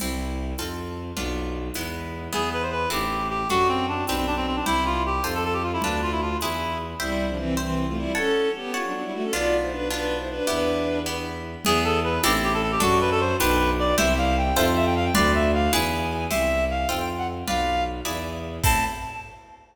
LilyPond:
<<
  \new Staff \with { instrumentName = "Clarinet" } { \time 6/8 \key a \minor \tempo 4. = 103 r2. | r2. | gis'8 b'16 c''16 b'8 g'4 g'8 | fis'8 c'8 d'8 c'16 c'16 d'16 c'16 c'16 d'16 |
e'8 f'8 g'8 r16 a'16 a'16 g'16 f'16 e'16 | d'8 f'16 e'16 f'8 e'4 r8 | r2. | r2. |
r2. | r2. | gis'8 a'8 b'8 g'16 r16 g'16 a'16 a'16 g'16 | fis'8 b'16 a'16 c''8 b'4 d''8 |
e''8 f''8 g''8 e''16 r16 e''16 g''16 f''16 g''16 | d''8 e''8 f''8 gis''4. | e''4 f''8 g''16 g''16 r16 ges''16 r8 | f''4 r2 |
a''4. r4. | }
  \new Staff \with { instrumentName = "Violin" } { \time 6/8 \key a \minor r2. | r2. | r2. | r2. |
r2. | r2. | <g e'>8. <f d'>16 <e c'>8 <e c'>8. <a f'>16 <g e'>8 | <cis' a'>4 <b g'>8 f'16 <fis d'>16 <fis d'>16 <g e'>16 <a fis'>16 <cis' a'>16 |
<f' d''>8. <e' c''>16 <d' b'>8 <d' b'>8. <e' c''>16 <d' b'>8 | <d' b'>4. r4. | r2. | r2. |
r2. | r2. | r2. | r2. |
r2. | }
  \new Staff \with { instrumentName = "Orchestral Harp" } { \time 6/8 \key a \minor <c' e' g'>4. <c' f' a'>4. | <b d' f'>4. <gis b e'>4. | <b e' gis'>4. <c' e' a'>4. | <d' fis' a'>4. <d' g' b'>4. |
<e' g' c''>4. <f' a' c''>4. | <f' b' d''>4. <e' gis' b'>4. | <c'' e'' g''>4. <c'' e'' g''>4. | <cis'' fis'' a''>4. <cis'' fis'' a''>4. |
<b d' f'>4. <b d' f'>4. | <b e' g'>4. <b e' g'>4. | <b e' gis'>4. <c' e' a'>4. | <d' fis' a'>4. <d' g' b'>4. |
<e' g' c''>4. <f' a' c''>4. | <f' b' d''>4. <e' gis' b'>4. | <e' g' c''>4. <f' a' c''>4. | <f' b' d''>4. <e' gis' b' d''>4. |
<c' e' a'>4. r4. | }
  \new Staff \with { instrumentName = "Violin" } { \clef bass \time 6/8 \key a \minor c,4. f,4. | b,,4. e,4. | e,4. a,,4. | fis,4. b,,4. |
c,4. f,4. | d,4. e,4. | c,2. | r2. |
b,,2. | e,2. | e,4. a,,4. | fis,4. b,,4. |
c,4. f,4. | d,4. e,4. | c,4. f,4. | b,,4. e,4. |
a,4. r4. | }
  \new DrumStaff \with { instrumentName = "Drums" } \drummode { \time 6/8 <cgl cymc>4. <cgho tamb>4. | cgl4. <cgho tamb>4. | cgl4. <cgho tamb>4. | cgl4. <cgho tamb>4. |
cgl4. <cgho tamb>4. | cgl4. <cgho tamb>4. | r4. r4. | r4. r4. |
r4. r4. | r4. r4. | cgl4. <cgho tamb>4. | cgl4. <cgho tamb>4. |
cgl4. <cgho tamb>4. | cgl4. <cgho tamb>4. | <cgl cymc>4. <cgho tamb>4. | cgl4. <cgho tamb>4. |
<cymc bd>4. r4. | }
>>